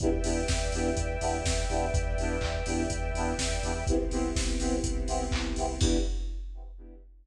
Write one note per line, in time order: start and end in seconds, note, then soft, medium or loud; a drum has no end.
0.00 0.21 E2 loud
0.00 0.09 B3 loud
0.00 0.09 D4 loud
0.00 0.09 E4 loud
0.00 0.09 G4 loud
0.00 3.84 B4 medium
0.00 3.84 D5 medium
0.00 3.84 E5 medium
0.00 3.84 G5 medium
0.00 kick medium
0.00 closed hi-hat medium
0.23 0.45 E2 medium
0.23 0.40 B3 medium
0.23 0.40 D4 medium
0.23 0.40 E4 medium
0.23 0.40 G4 loud
0.23 open hi-hat medium
0.48 0.70 E2 medium
0.48 kick medium
0.48 snare medium
0.72 0.93 E2 medium
0.72 0.90 B3 medium
0.72 0.90 D4 medium
0.72 0.90 E4 medium
0.72 0.90 G4 loud
0.72 open hi-hat medium
0.96 1.17 E2 loud
0.96 kick medium
0.96 closed hi-hat medium
1.21 1.42 E2 medium
1.21 1.38 B3 loud
1.21 1.38 D4 medium
1.21 1.38 E4 medium
1.21 1.38 G4 medium
1.21 open hi-hat medium
1.44 1.65 E2 medium
1.44 kick medium
1.44 snare loud
1.69 1.90 E2 medium
1.69 1.86 B3 medium
1.69 1.86 D4 medium
1.69 1.86 E4 loud
1.69 1.86 G4 medium
1.69 open hi-hat medium
1.94 2.15 E2 medium
1.94 kick loud
1.94 closed hi-hat medium
2.18 2.38 E2 medium
2.18 2.36 B3 medium
2.18 2.36 D4 loud
2.18 2.36 E4 medium
2.18 2.36 G4 medium
2.18 open hi-hat medium
2.41 2.62 E2 medium
2.41 kick medium
2.41 clap medium
2.66 2.87 E2 medium
2.66 2.83 B3 medium
2.66 2.83 D4 medium
2.66 2.83 E4 medium
2.66 2.83 G4 medium
2.66 open hi-hat medium
2.90 3.11 E2 medium
2.90 kick medium
2.90 closed hi-hat loud
3.14 3.34 E2 medium
3.14 3.33 B3 loud
3.14 3.33 D4 medium
3.14 3.33 E4 medium
3.14 3.33 G4 medium
3.14 open hi-hat medium
3.38 3.59 E2 medium
3.38 kick medium
3.38 snare loud
3.63 3.84 E2 loud
3.63 3.72 B3 medium
3.63 3.72 D4 medium
3.63 3.72 E4 medium
3.63 3.72 G4 medium
3.63 open hi-hat medium
3.87 4.07 C2 loud
3.87 5.79 B3 medium
3.87 3.96 B3 loud
3.87 5.79 C4 medium
3.87 3.96 C4 loud
3.87 5.79 E4 medium
3.87 3.96 E4 loud
3.87 5.79 G4 medium
3.87 3.96 G4 loud
3.87 kick medium
3.87 closed hi-hat medium
4.11 4.32 C2 medium
4.11 4.28 B3 medium
4.11 4.28 C4 medium
4.11 4.28 E4 medium
4.11 4.28 G4 loud
4.11 open hi-hat medium
4.35 4.56 C2 medium
4.35 kick medium
4.35 snare medium
4.59 4.81 C2 medium
4.59 4.76 B3 loud
4.59 4.76 C4 loud
4.59 4.76 E4 medium
4.59 4.76 G4 medium
4.59 open hi-hat medium
4.84 5.05 C2 medium
4.84 kick medium
4.84 closed hi-hat loud
5.07 5.29 C2 medium
5.07 5.24 B3 loud
5.07 5.24 C4 loud
5.07 5.24 E4 loud
5.07 5.24 G4 medium
5.07 open hi-hat medium
5.31 5.53 C2 medium
5.31 kick medium
5.31 clap loud
5.56 5.78 C2 medium
5.56 5.65 B3 medium
5.56 5.65 C4 medium
5.56 5.65 E4 medium
5.56 5.65 G4 medium
5.56 open hi-hat medium
5.80 5.98 E2 loud
5.80 5.97 B3 loud
5.80 5.97 B3 medium
5.80 5.97 D4 loud
5.80 5.97 D4 medium
5.80 5.97 E4 loud
5.80 5.97 G4 loud
5.80 kick loud
5.80 crash loud